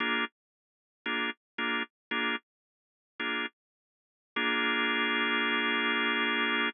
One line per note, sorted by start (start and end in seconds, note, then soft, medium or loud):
0.00 0.25 A#3 loud
0.00 0.25 D4 medium
0.00 0.25 F4 medium
0.00 0.25 G#4 medium
1.06 1.30 A#3 medium
1.06 1.30 D4 medium
1.06 1.30 F4 medium
1.06 1.30 G#4 medium
1.58 1.83 A#3 medium
1.58 1.83 D4 medium
1.58 1.83 F4 medium
1.58 1.83 G#4 medium
2.11 2.36 A#3 medium
2.11 2.36 D4 medium
2.11 2.36 F4 medium
2.11 2.36 G#4 medium
3.20 3.46 A#3 medium
3.20 3.46 D4 medium
3.20 3.46 F4 medium
3.20 3.46 G#4 medium
4.36 6.69 A#3 loud
4.36 6.69 D4 loud
4.36 6.69 F4 medium
4.36 6.69 G#4 loud